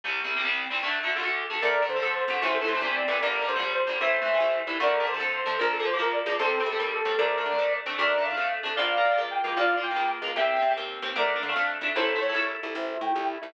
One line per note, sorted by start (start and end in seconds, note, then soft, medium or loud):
0.04 0.20 C2 medium
0.04 0.20 C3 medium
0.04 0.20 G3 medium
0.24 0.34 C2 medium
0.24 0.34 C3 medium
0.24 0.34 G3 medium
0.36 0.42 C2 medium
0.36 0.42 C3 medium
0.36 0.42 G3 medium
0.44 0.65 C2 medium
0.44 0.65 C3 medium
0.44 0.65 G3 medium
0.70 0.81 C2 medium
0.70 0.81 C3 medium
0.70 0.81 G3 medium
0.83 0.99 D2 medium
0.83 0.99 D3 loud
0.83 0.99 A3 loud
1.03 1.14 D2 medium
1.03 1.14 D3 medium
1.03 1.14 A3 medium
1.16 1.21 D2 medium
1.16 1.21 D3 medium
1.16 1.21 A3 medium
1.22 1.43 D2 medium
1.22 1.43 D3 medium
1.22 1.43 A3 medium
1.50 1.60 D2 medium
1.50 1.60 D3 medium
1.50 1.60 A3 medium
1.62 1.85 D2 loud
1.62 1.78 D3 loud
1.62 1.78 A3 loud
1.62 1.84 A#4 medium
1.62 1.84 D5 loud
1.82 1.93 D3 medium
1.82 1.93 A3 loud
1.89 2.00 D3 medium
1.89 2.11 C5 medium
1.96 2.01 D3 medium
1.96 2.01 A3 medium
2.02 2.25 F2 loud
2.02 2.23 D3 loud
2.02 2.23 A3 medium
2.14 2.39 C5 medium
2.28 2.39 F2 loud
2.28 2.40 D3 loud
2.28 2.40 A3 medium
2.42 2.65 A1 loud
2.42 2.58 C3 loud
2.42 2.58 E3 loud
2.42 2.58 A3 loud
2.42 2.56 C5 loud
2.54 2.66 A4 medium
2.61 2.72 C3 loud
2.61 2.72 E3 loud
2.61 2.72 A3 loud
2.67 2.79 A2 medium
2.67 2.78 C5 medium
2.74 2.79 C3 medium
2.74 2.79 E3 medium
2.74 2.79 A3 loud
2.81 3.04 C2 medium
2.81 3.03 C3 loud
2.81 3.03 E3 medium
2.81 3.03 A3 medium
2.81 2.94 C5 medium
2.95 3.18 D5 medium
3.08 3.19 C2 medium
3.08 3.18 C3 loud
3.08 3.18 E3 loud
3.08 3.18 A3 medium
3.21 3.45 G1 loud
3.21 3.38 D3 loud
3.21 3.38 G3 loud
3.21 3.46 A#4 medium
3.21 3.46 D5 medium
3.42 3.52 D3 medium
3.42 3.52 G3 medium
3.47 3.60 G2 loud
3.47 3.70 C5 medium
3.56 3.82 A#1 medium
3.56 3.61 D3 loud
3.56 3.61 G3 medium
3.62 3.83 D3 medium
3.62 3.83 G3 loud
3.74 3.98 C5 medium
3.87 4.00 A#1 medium
3.87 3.98 D3 medium
3.87 3.98 G3 loud
4.01 4.23 A1 medium
4.01 4.17 E3 loud
4.01 4.17 A3 loud
4.01 4.59 C5 medium
4.01 4.59 E5 medium
4.22 4.32 E3 medium
4.22 4.32 A3 loud
4.28 4.39 A2 medium
4.34 4.39 E3 medium
4.34 4.39 A3 medium
4.40 4.62 C2 medium
4.40 4.62 E3 medium
4.40 4.62 A3 loud
4.67 4.78 C2 medium
4.67 4.78 E3 loud
4.67 4.78 A3 medium
4.80 5.02 D2 loud
4.80 4.96 D3 loud
4.80 4.96 A3 loud
4.80 5.06 A#4 medium
4.80 5.06 D5 medium
5.00 5.10 D3 medium
5.00 5.10 A3 loud
5.07 5.18 D3 medium
5.07 5.28 C5 medium
5.14 5.19 D3 loud
5.14 5.19 A3 loud
5.19 5.42 F2 medium
5.19 5.41 D3 loud
5.19 5.41 A3 medium
5.33 5.57 C5 medium
5.46 5.58 F2 medium
5.46 5.56 D3 medium
5.46 5.56 A3 medium
5.59 5.83 A#1 loud
5.59 5.75 F3 loud
5.59 5.75 A#3 loud
5.59 5.72 A#4 medium
5.73 5.83 A4 medium
5.79 5.90 F3 loud
5.79 5.90 A#3 loud
5.85 5.97 A#2 medium
5.85 5.98 C5 medium
5.93 5.99 F3 medium
5.93 5.98 A#3 loud
5.99 6.22 C#2 medium
5.99 6.20 F3 medium
5.99 6.20 A#3 medium
5.99 6.13 A#4 medium
6.12 6.34 D5 medium
6.26 6.37 C#2 loud
6.26 6.36 F3 medium
6.26 6.36 A#3 medium
6.39 6.62 C2 loud
6.39 6.56 G3 loud
6.39 6.56 C4 loud
6.39 6.61 A4 medium
6.39 6.61 C5 loud
6.60 6.70 G3 loud
6.60 6.70 C4 medium
6.66 6.77 C3 loud
6.66 6.88 A4 medium
6.72 6.77 G3 medium
6.72 6.77 C4 medium
6.79 7.02 D#2 loud
6.79 7.00 G3 medium
6.79 7.00 C4 medium
6.92 7.17 A4 medium
7.05 7.16 D#2 loud
7.05 7.16 G3 medium
7.05 7.16 C4 medium
7.18 7.41 D2 loud
7.18 7.35 A3 loud
7.18 7.35 D4 loud
7.18 7.73 A#4 medium
7.18 7.73 D5 medium
7.38 7.48 A3 medium
7.38 7.48 D4 medium
7.46 7.57 D3 medium
7.51 7.57 A3 medium
7.51 7.57 D4 medium
7.58 7.81 F2 medium
7.58 7.80 A3 medium
7.58 7.80 D4 loud
7.86 7.97 F2 medium
7.86 7.97 A3 loud
7.86 7.97 D4 loud
7.98 8.21 D2 loud
7.98 8.14 A3 loud
7.98 8.14 D4 loud
7.98 8.23 A#4 medium
7.98 8.23 D5 medium
8.18 8.28 A3 medium
8.18 8.28 D4 medium
8.25 8.36 D3 medium
8.25 8.48 F5 medium
8.30 8.35 A3 medium
8.30 8.35 D4 medium
8.37 8.60 F2 medium
8.37 8.59 A3 medium
8.37 8.59 D4 medium
8.63 8.76 F2 medium
8.63 8.74 A3 loud
8.63 8.74 D4 loud
8.76 9.01 A#1 loud
8.76 8.93 A#3 loud
8.76 8.93 F4 loud
8.76 9.20 D5 medium
8.76 9.20 F5 loud
8.97 9.08 A#3 medium
8.97 9.08 F4 loud
9.05 9.16 A#2 medium
9.11 9.16 A#3 medium
9.11 9.16 F4 loud
9.17 9.40 C#2 medium
9.17 9.39 A#3 loud
9.17 9.39 F4 medium
9.31 9.55 G5 medium
9.44 9.55 C#2 medium
9.44 9.55 A#3 loud
9.44 9.55 F4 loud
9.57 9.80 A#1 loud
9.57 9.72 A#3 loud
9.57 9.72 F4 loud
9.57 9.81 D5 medium
9.57 9.81 F5 loud
9.77 9.88 A#3 medium
9.77 9.88 F4 loud
9.83 9.95 A#2 medium
9.83 10.08 G5 medium
9.91 9.96 A#3 medium
9.91 9.96 F4 loud
9.96 10.19 C#2 medium
9.96 10.18 A#3 loud
9.96 10.18 F4 medium
10.22 10.33 C#2 medium
10.22 10.34 A#3 medium
10.22 10.34 F4 medium
10.36 10.58 C2 loud
10.36 10.53 C4 loud
10.36 10.53 G4 loud
10.36 10.69 E5 medium
10.36 10.69 G5 loud
10.56 10.67 C4 medium
10.56 10.67 G4 medium
10.62 10.73 C3 medium
10.71 10.76 C4 medium
10.71 10.76 G4 loud
10.77 11.00 D#2 loud
10.77 10.98 C4 loud
10.77 10.98 G4 medium
11.02 11.14 D#2 loud
11.02 11.13 C4 loud
11.02 11.13 G4 medium
11.16 11.38 D2 loud
11.16 11.31 A3 loud
11.16 11.31 D4 loud
11.16 11.42 A#4 medium
11.16 11.42 D5 medium
11.36 11.46 A3 medium
11.36 11.46 D4 loud
11.43 11.54 D3 medium
11.43 11.67 F5 medium
11.49 11.54 A3 medium
11.49 11.54 D4 medium
11.56 11.78 F2 loud
11.56 11.78 A3 medium
11.56 11.78 D4 loud
11.81 11.92 F2 loud
11.81 11.93 A3 medium
11.81 11.93 D4 loud
11.95 12.18 A1 loud
11.95 12.12 A3 loud
11.95 12.12 E4 loud
11.95 12.17 A4 medium
11.95 12.17 C5 medium
12.15 12.26 A3 loud
12.15 12.26 E4 loud
12.21 12.34 A2 medium
12.21 12.46 C#5 medium
12.29 12.34 A3 loud
12.29 12.34 E4 loud
12.34 12.57 C2 loud
12.34 12.57 A3 loud
12.34 12.57 E4 loud
12.63 12.74 C2 medium
12.63 12.74 A3 loud
12.63 12.74 E4 medium
12.74 12.98 A1 loud
12.74 12.90 A3 loud
12.74 12.90 E4 loud
12.74 12.98 C5 medium
12.74 12.98 E5 medium
12.94 13.05 A3 loud
12.94 13.05 E4 loud
13.01 13.12 A2 medium
13.01 13.24 G5 medium
13.09 13.14 A3 loud
13.09 13.13 E4 loud
13.14 13.38 C2 medium
13.14 13.35 A3 loud
13.14 13.35 E4 loud
13.42 13.53 C2 medium
13.42 13.52 A3 medium
13.42 13.52 E4 medium